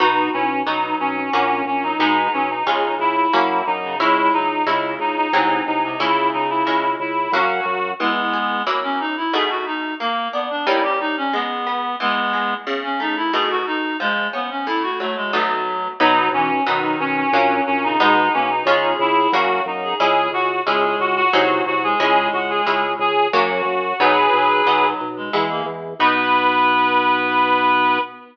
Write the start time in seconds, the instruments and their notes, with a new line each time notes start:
0.00 drawbar organ B1, orchestral harp B3 D#4 F#4, clarinet D#4 F#4
0.33 drawbar organ B1, clarinet C#4 E4
0.66 drawbar organ B1, clarinet F#3 D#4, orchestral harp B3 D#4 F#4
1.00 drawbar organ B1, clarinet C#4
1.17 clarinet C#4
1.33 drawbar organ A#1, orchestral harp A#3 C#4 F#4, clarinet C#4
1.65 drawbar organ A#1, clarinet C#4
1.83 clarinet F#3 D#4
1.99 drawbar organ B1, clarinet G#3 D#4, orchestral harp G#3 B3 D#4
2.33 drawbar organ B1, clarinet F#3 C#4
2.50 clarinet D#4
2.66 drawbar organ C#2, clarinet C#3, orchestral harp G#3 C#4 F4
2.99 drawbar organ C#2, clarinet E4
3.33 drawbar organ F#2, orchestral harp A#3 C#4 F#4, clarinet E4
3.67 drawbar organ F#2, clarinet D#4
3.83 clarinet C#3
4.00 drawbar organ C#2, clarinet G#3 E4, orchestral harp G#3 C#4 E4
4.33 drawbar organ C#2, clarinet F#3 D#4
4.66 drawbar organ C#2, clarinet C#3 E4, orchestral harp G#3 C#4 E4
4.99 drawbar organ C#2, clarinet D#4
5.17 clarinet D#4
5.33 drawbar organ C2, orchestral harp F#3 G#3 C4 D#4, clarinet D#4
5.67 drawbar organ C2, clarinet D#4
5.83 clarinet C3 D#4
6.00 drawbar organ C#2, clarinet C#3 E4, orchestral harp G#3 C#4 E4
6.33 drawbar organ C#2, clarinet D#4
6.50 clarinet E4
6.67 drawbar organ C#2, orchestral harp G#3 C#4 E4
7.00 drawbar organ C#2, clarinet E4
7.32 drawbar organ F#2, orchestral harp F#3 A#3 C#4, clarinet F#4
7.65 drawbar organ F#2
7.99 orchestral harp E3, clarinet G#3 B3
8.33 orchestral harp G#4
8.67 orchestral harp F#3 A#3 C#4 E4
8.83 clarinet C#4
9.00 clarinet D#4
9.17 clarinet E4
9.33 orchestral harp B2 A3 D#4 F#4, clarinet G#4
9.50 clarinet F#4
9.66 clarinet D#4
10.00 orchestral harp A#3, clarinet A#3
10.33 clarinet B3, orchestral harp D4
10.50 clarinet D4
10.67 orchestral harp G3 A#3 C#4 D#4, clarinet E4
10.83 clarinet G4
11.00 clarinet D#4
11.17 clarinet C#4
11.33 orchestral harp G#3, clarinet B3
11.67 orchestral harp B3
12.00 orchestral harp E3, clarinet G#3 B3
12.33 orchestral harp G#3
12.67 orchestral harp C#3
12.83 clarinet C#4
13.00 orchestral harp A3, clarinet D#4
13.17 clarinet E4
13.33 orchestral harp B2 A3 D#4 F#4, clarinet G#4
13.50 clarinet F#4
13.66 clarinet D#4
14.00 orchestral harp F3, clarinet G#3
14.33 clarinet B3, orchestral harp C#4
14.50 clarinet C#4
14.67 orchestral harp A2, clarinet E4
14.83 clarinet F#4
15.00 orchestral harp F#3, clarinet A3
15.16 clarinet G#3
15.33 orchestral harp B2 F#3 A3 D#4, clarinet F#3
16.00 drawbar organ B1, orchestral harp F#3 B3 D#4, clarinet F#3 D#4
16.32 drawbar organ B1, clarinet E3 C#4
16.67 drawbar organ B1, clarinet D#3 D#4, orchestral harp F#3 B3 D#4
17.00 drawbar organ B1, clarinet C#4
17.17 clarinet C#4
17.33 drawbar organ A#1, orchestral harp F#3 A#3 C#4, clarinet C#4
17.67 drawbar organ A#1, clarinet C#4
17.83 clarinet C#3 D#4
18.00 drawbar organ B1, clarinet G#3 D#4, orchestral harp G#3 B3 D#4
18.33 drawbar organ B1, clarinet A#3 C#4
18.50 clarinet D#4
18.65 drawbar organ C#2, orchestral harp G#3 C#4 F4, clarinet G#4
18.99 drawbar organ C#2, clarinet E4
19.32 drawbar organ F#2, orchestral harp A#3 C#4 F#4, clarinet F#4
19.66 drawbar organ F#2, clarinet D#4
19.83 clarinet G#4
20.00 drawbar organ C#2, orchestral harp G#3 C#4 E4, clarinet G#4
20.32 drawbar organ C#2, clarinet F#4
20.66 drawbar organ C#2, clarinet G#3 G#4, orchestral harp G#3 C#4 E4
20.99 drawbar organ C#2, clarinet F#4
21.17 clarinet F#4
21.33 drawbar organ C2, orchestral harp F#3 G#3 C4 D#4, clarinet F#4
21.66 drawbar organ C2, clarinet F#4
21.83 clarinet G#3 G#4
21.99 drawbar organ C#2, clarinet G#3 G#4, orchestral harp G#3 C#4 E4
22.33 drawbar organ C#2, clarinet F#4
22.50 clarinet G#4
22.67 drawbar organ C#2, orchestral harp G#3 C#4 E4
22.99 drawbar organ C#2, clarinet G#4
23.33 drawbar organ F#2, orchestral harp F#3 A#3 C#4, clarinet F#4
23.65 drawbar organ F#2
24.00 drawbar organ B1, orchestral harp F#3 B3 D#4, clarinet F#3 G#4 B4
24.33 drawbar organ B1, clarinet F#3
24.65 drawbar organ B1, clarinet F#3, orchestral harp F#3 B3 D#4
25.01 drawbar organ B1
25.17 clarinet G#3
25.33 drawbar organ E2, orchestral harp G#3 B3 E4
25.50 clarinet A#3
25.66 drawbar organ E2
25.99 drawbar organ B1, clarinet B3 B4, orchestral harp B3 D#4 F#4